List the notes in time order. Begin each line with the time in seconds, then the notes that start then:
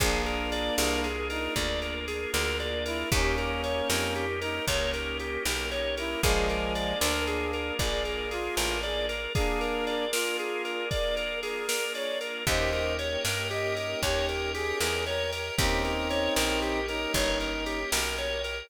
0.00 A#1 A#3 D4 F4 G#4, kick, ride
0.26 A#4, ride
0.52 D5, ride
0.78 C2 A#3 D4 F4 G#4 A#4, snare
1.04 G#4, ride
1.30 D#4 A#4, ride
1.56 D2 A#3 D4 F4 G#4 D5, kick, ride
1.82 A#4, ride
2.08 G#4, ride
2.33 D2 A#3 D4 F4 G#4 A#4, snare
2.60 D5, ride
2.86 E4 A#4, ride
3.11 D#2 A#3 C#4 D#4 G4, kick, ride
3.38 A#4, ride
3.64 C#5, ride
3.90 F2 A#3 C#4 D#4 G4 A#4, snare
4.16 G4, ride
4.41 D#4 A#4, ride
4.67 C#2 A#3 C#4 D#4 G4 C#5, kick, ride
4.94 A#4, ride
5.19 G4, ride
5.45 B1 A#3 C#4 D#4 G4 A#4, snare
5.71 C#5, ride
5.97 E4 A#4, ride
6.22 A#1 F3 G#3 A#3 D4 F4 G#4 A#4 D5 F5 G#5, kick, ride
6.49 A#4, ride
6.75 D5, ride
7.01 D2 D4 A#4, snare
7.27 G#4, ride
7.53 A#4, ride
7.79 A#1 G#4 D5, kick, ride
8.05 A#4, ride
8.31 F4 G#4, ride
8.57 A1 A#4, snare
8.83 G#4 D5, ride
9.09 A#4, ride
9.35 A#3 D4 F4 G#4 A#4 D5 F5 G#5, kick, ride
9.61 A#4, ride
9.87 D5, ride
10.12 F4 A#4, snare
10.39 G#4, ride
10.65 A#4, ride
10.91 D5, kick, ride
11.17 A#4, ride
11.43 G#4 A#4, ride
11.69 A#4, snare
11.95 C#5 D5, ride
12.21 A#4, ride
12.46 D#2 A#3 C#4 D#4 G4 A#4 C5 C#5 D#5 G5, kick, ride
12.73 A#4, ride
12.99 C#5, ride
13.25 G2 A#4, snare
13.51 G4 D#5, ride
13.77 A#4, ride
14.03 D#2 G4 C#5, kick, ride
14.29 A#4, ride
14.54 G4 G#4, ride
14.81 E2 A#4, snare
15.06 A#4 C#5, ride
15.32 A#4, ride
15.57 D#2 A#3 C4 C#4 D#4 G4 A#4 C#5 D#5 G5, kick, ride
15.84 A#4, ride
16.10 C#5, ride
16.36 A#1 A#4, snare
16.62 G4, ride
16.88 D#4 A#4, ride
17.14 G1 C#5, kick, ride
17.40 A#4, ride
17.66 G4, ride
17.92 B1 A#4, snare
18.18 C#5, ride
18.44 A#4, ride